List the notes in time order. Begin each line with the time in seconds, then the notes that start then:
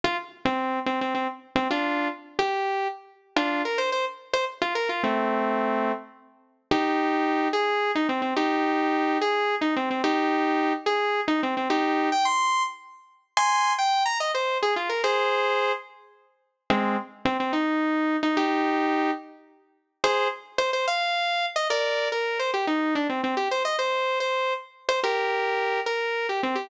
0.04 F4
0.45 C4
0.86 C4
1.01 C4
1.14 C4
1.56 C4
1.70 D4 F4
2.39 G4
3.36 D4 F4
3.65 A#4
3.78 C5
3.92 C5
4.33 C5
4.62 F4
4.75 A#4
4.89 F4
5.03 A3 C4
6.71 D#4 G4
7.53 G#4
7.95 D#4
8.09 C4
8.22 C4
8.36 D#4 G4
9.21 G#4
9.61 D#4
9.76 C4
9.90 C4
10.04 D#4 G4
10.86 G#4
11.28 D#4
11.43 C4
11.57 C4
11.70 D#4 G4
12.12 G5
12.25 C6
13.37 G#5 C6
13.78 G5
14.05 A#5
14.20 D#5
14.34 C5
14.62 G#4
14.76 F4
14.89 A#4
15.04 G#4 C5
16.70 G#3 C4
17.25 C4
17.40 C4
17.53 D#4
18.23 D#4
18.37 D#4 G4
20.04 G#4 C5
20.58 C5
20.73 C5
20.87 F5
21.56 D#5
21.70 A#4 D5
22.12 A#4
22.39 C5
22.54 G4
22.67 D#4
22.95 D4
23.09 C4
23.23 C4
23.37 G4
23.51 C5
23.65 D#5
23.79 C5
24.20 C5
24.89 C5
25.03 G4 A#4
25.86 A#4
26.29 G4
26.43 C4
26.55 G4